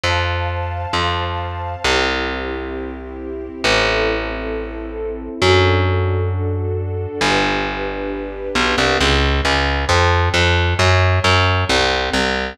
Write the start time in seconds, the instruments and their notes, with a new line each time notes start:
0.04 electric bass (finger) F2, string ensemble 1 C5 F5 A5
0.93 electric bass (finger) F2
1.84 electric bass (finger) C2, string ensemble 1 C4 E4 G4
3.63 electric bass (finger) A1, string ensemble 1 C4 E4 A4
5.42 electric bass (finger) F#2, string ensemble 1 D4 F#4 A4
7.21 electric bass (finger) G1, string ensemble 1 D4 G4 B4
8.55 electric bass (finger) B1
8.78 electric bass (finger) C2
9.00 electric bass (finger) C#2
9.45 electric bass (finger) C#2
9.89 electric bass (finger) F2
10.34 electric bass (finger) F2
10.79 electric bass (finger) F#2
11.24 electric bass (finger) F#2
11.69 electric bass (finger) C2
12.13 electric bass (finger) C2